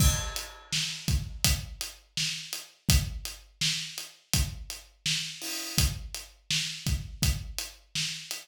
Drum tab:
CC |x-------|--------|--------|
HH |-x-xxx-x|xx-xxx-o|xx-xxx-x|
SD |--o---o-|--o---o-|--o---o-|
BD |o--oo---|o---o---|o--oo---|